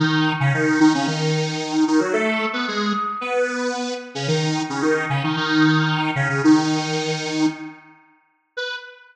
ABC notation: X:1
M:4/4
L:1/16
Q:1/4=112
K:B
V:1 name="Lead 1 (square)"
[D,D]3 [C,C] [D,D]2 [D,D] [C,C] [D,D]6 [D,D] [F,F] | [=A,=A]3 [B,B] [G,G]2 z2 [B,B]6 z [C,C] | [D,D]3 [C,C] [D,D]2 [C,C] [D,D] [D,D]6 [C,C] [C,C] | [D,D]8 z8 |
B4 z12 |]